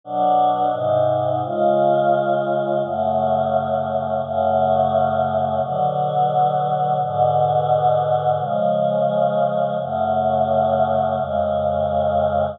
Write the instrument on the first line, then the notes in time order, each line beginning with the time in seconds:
choir aahs
0.04 B2 F#3 D4
0.73 G#2 C3 D#4
1.44 C#3 G#3 F4
2.83 F#2 C#3 A3
4.23 F#2 C#3 A3
5.62 B2 D3 F#3
7.02 G#2 B2 D3
8.39 C#3 F3 G#3
9.81 F#2 C#3 A3
11.18 F2 C#3 G#3